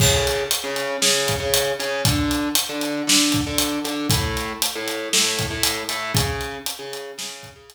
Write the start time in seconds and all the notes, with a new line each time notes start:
0.00 C#3 C#4 G#4, kick, crash
0.27 closed hi-hat
0.51 closed hi-hat
0.64 C#3 C#4 G#4
0.76 closed hi-hat
1.02 C#3 C#4 G#4, snare
1.28 kick, closed hi-hat
1.40 C#3 C#4 G#4
1.54 closed hi-hat
1.79 C#3 C#4 G#4, closed hi-hat
2.05 D3 D4 A4, kick, closed hi-hat
2.31 closed hi-hat
2.55 closed hi-hat
2.69 D3 D4 A4
2.81 closed hi-hat
3.07 D3 D4 A4, snare
3.32 kick, closed hi-hat
3.47 D3 D4 A4
3.58 closed hi-hat
3.85 D3 D4 A4, closed hi-hat
4.10 A3 E4 A4, kick, closed hi-hat
4.37 closed hi-hat
4.62 closed hi-hat
4.75 A3 E4 A4
4.88 closed hi-hat
5.13 A3 E4 A4, snare
5.39 kick, closed hi-hat
5.51 A3 E4 A4
5.63 closed hi-hat
5.89 A3 E4 A4, closed hi-hat
6.14 C#3 C#4 G#4, kick, closed hi-hat
6.41 closed hi-hat
6.66 closed hi-hat
6.79 C#3 C#4 G#4
6.93 closed hi-hat
7.18 C#3 C#4 G#4, snare
7.43 kick, closed hi-hat
7.56 C#3 C#4 G#4
7.70 closed hi-hat